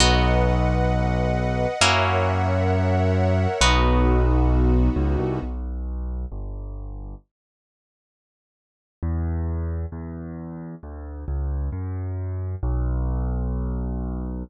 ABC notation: X:1
M:4/4
L:1/8
Q:1/4=133
K:B
V:1 name="Orchestral Harp"
[B,DF]8 | [A,CEF]8 | [B,DF]8 | [K:Bm] z8 |
z8 | z8 | z8 | z8 |]
V:2 name="Acoustic Grand Piano" clef=bass
B,,,8 | F,,8 | B,,,6 C,, =C,, | [K:Bm] B,,,4 G,,,4 |
z8 | E,,4 E,,4 | D,,2 C,,2 F,,4 | B,,,8 |]
V:3 name="String Ensemble 1"
[Bdf]8 | [Acef]8 | [B,DF]8 | [K:Bm] z8 |
z8 | z8 | z8 | z8 |]